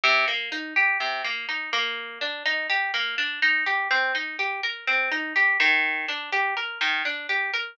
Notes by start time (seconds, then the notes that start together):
0.04 C3
0.28 A#3
0.52 D#4
0.76 G4
1.00 C3
1.24 A#3
1.49 D#4
1.73 A#3
2.21 D4
2.46 D#4
2.70 G4
2.94 A#3
3.18 D4
3.42 D#4
3.66 G4
3.91 C4
4.15 D#4
4.39 G4
4.63 A#4
4.87 C4
5.11 D#4
5.36 G4
5.60 D#3
6.08 D4
6.32 G4
6.57 A#4
6.81 D#3
7.05 D4
7.29 G4
7.54 A#4